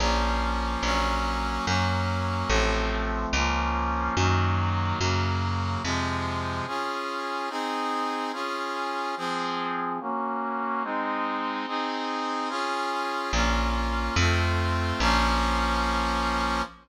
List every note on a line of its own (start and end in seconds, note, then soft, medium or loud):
0.00 0.77 A#1 loud
0.00 0.82 F3 medium
0.00 0.82 A#3 medium
0.00 0.82 C#4 medium
0.83 1.59 A#1 medium
0.83 1.66 F#3 medium
0.83 1.66 A#3 medium
0.83 1.66 C#4 medium
1.66 2.44 F#2 loud
1.66 2.49 F#3 medium
1.66 2.49 A#3 medium
1.66 2.49 C#4 medium
2.49 3.26 A1 loud
2.49 3.32 F3 medium
2.49 3.32 A3 medium
2.49 3.32 C4 medium
3.33 4.10 C#2 loud
3.33 4.15 F3 medium
3.33 4.15 A#3 medium
3.33 4.15 C#4 medium
4.17 4.93 F#2 loud
4.17 4.99 D#3 medium
4.17 4.99 F#3 medium
4.17 4.99 A#3 medium
5.00 5.77 F#2 medium
5.00 5.82 C#3 medium
5.00 5.82 F#3 medium
5.00 5.82 A#3 medium
5.84 6.61 F2 medium
5.84 6.66 C3 medium
5.84 6.66 F3 medium
5.84 6.66 G#3 medium
6.67 7.49 C#4 medium
6.67 7.49 F4 medium
6.67 7.49 G#4 medium
7.49 8.32 C4 medium
7.49 8.32 D#4 medium
7.49 8.32 G#4 medium
8.33 9.15 C#4 medium
8.33 9.15 F4 medium
8.33 9.15 G#4 medium
9.17 9.99 F3 medium
9.17 9.99 C4 medium
9.17 9.99 G#4 medium
10.01 10.83 A#3 medium
10.01 10.83 C#4 medium
10.01 10.83 F#4 medium
10.84 11.66 G#3 medium
10.84 11.66 C4 medium
10.84 11.66 D#4 medium
11.67 12.50 C4 medium
11.67 12.50 D#4 medium
11.67 12.49 G#4 medium
12.49 13.32 C#4 medium
12.49 13.32 F4 medium
12.49 13.32 G#4 medium
13.33 14.10 A#1 loud
13.33 14.16 A#3 medium
13.33 14.16 C#4 medium
13.33 14.16 F4 medium
14.16 14.93 F2 loud
14.16 15.00 A3 medium
14.16 15.00 C4 medium
14.16 15.00 F4 medium
15.00 16.62 A#1 loud
15.00 16.62 F3 loud
15.00 16.62 A#3 medium
15.00 16.62 C#4 loud